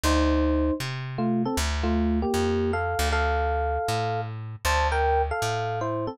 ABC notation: X:1
M:4/4
L:1/8
Q:"Swing" 1/4=156
K:Dm
V:1 name="Electric Piano 1"
[_Ec]4 z2 [A,F] [CA] | z [A,F]2 [B,G]3 [Af]2 | [Af]6 z2 | [ca] [Bg]2 [Af]3 [Ec] [CA] |]
V:2 name="Electric Bass (finger)" clef=bass
D,,4 C,4 | D,,4 F,,3 D,,- | D,,4 A,,4 | D,,4 A,,4 |]